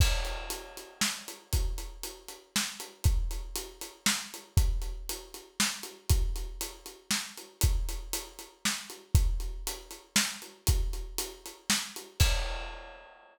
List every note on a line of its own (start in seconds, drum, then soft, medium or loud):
0.00 kick loud
0.00 crash loud
0.25 closed hi-hat medium
0.50 closed hi-hat medium
0.77 closed hi-hat medium
1.01 snare loud
1.28 closed hi-hat medium
1.53 kick medium
1.53 closed hi-hat loud
1.78 closed hi-hat medium
2.03 closed hi-hat medium
2.28 closed hi-hat medium
2.56 snare loud
2.80 closed hi-hat medium
3.04 kick loud
3.04 closed hi-hat medium
3.31 closed hi-hat medium
3.56 closed hi-hat loud
3.81 closed hi-hat medium
4.06 snare loud
4.34 closed hi-hat medium
4.57 kick loud
4.57 closed hi-hat loud
4.82 closed hi-hat medium
5.09 closed hi-hat loud
5.34 closed hi-hat medium
5.60 snare loud
5.83 closed hi-hat medium
6.10 kick loud
6.10 closed hi-hat loud
6.36 closed hi-hat medium
6.61 closed hi-hat loud
6.86 closed hi-hat medium
7.11 snare loud
7.37 closed hi-hat medium
7.61 kick loud
7.61 closed hi-hat loud
7.89 closed hi-hat medium
8.13 closed hi-hat loud
8.39 closed hi-hat medium
8.65 snare loud
8.90 closed hi-hat medium
9.15 kick loud
9.15 closed hi-hat loud
9.40 closed hi-hat medium
9.67 closed hi-hat loud
9.91 closed hi-hat medium
10.16 snare loud
10.42 closed hi-hat medium
10.67 kick loud
10.67 closed hi-hat loud
10.93 closed hi-hat medium
11.18 closed hi-hat loud
11.46 closed hi-hat medium
11.70 snare loud
11.96 closed hi-hat medium
12.20 kick loud
12.20 crash loud